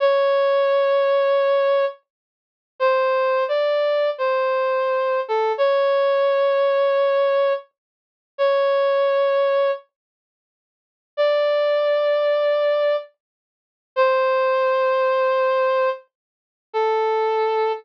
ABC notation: X:1
M:4/4
L:1/8
Q:"Swing" 1/4=86
K:A
V:1 name="Brass Section"
c6 z2 | =c2 d2 c3 A | c6 z2 | c4 z4 |
d6 z2 | =c6 z2 | A3 z5 |]